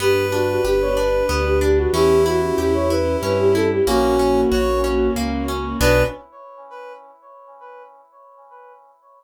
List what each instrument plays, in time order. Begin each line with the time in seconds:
0.00 acoustic grand piano G1, orchestral harp B3, string ensemble 1 B3 D4 G4, flute G4, brass section B4
0.32 orchestral harp D4, flute F#4
0.49 flute F#4
0.65 acoustic grand piano G1, flute G4, orchestral harp G4
0.81 flute C#5
0.97 orchestral harp D4, flute B4
1.29 acoustic grand piano D2, orchestral harp B3, flute B4
1.45 flute G4
1.61 orchestral harp D4, flute G4
1.78 flute F#4
1.93 acoustic grand piano E2, orchestral harp C#4, string ensemble 1 C#4 E4 G4, brass section E4, flute G4
2.26 orchestral harp E4, flute F#4
2.42 flute F#4
2.58 acoustic grand piano E2, flute G4, orchestral harp G4
2.74 flute C#5
2.90 orchestral harp E4, flute B4
3.22 acoustic grand piano G2, orchestral harp C#4, flute B4
3.39 flute G4
3.55 orchestral harp E4, flute A4
3.71 flute G4
3.86 acoustic grand piano A#1, string ensemble 1 A#3 C#4 F#4, orchestral harp A#3, brass section C#4, flute F#4
4.19 orchestral harp C#4
4.51 acoustic grand piano A#1, orchestral harp F#4, brass section C#5
4.84 orchestral harp C#4
5.16 acoustic grand piano C#2, orchestral harp A#3
5.48 orchestral harp C#4
5.80 acoustic grand piano B1, orchestral harp B3 D4 F#4, string ensemble 1 B3 D4 F#4, brass section B4, flute B4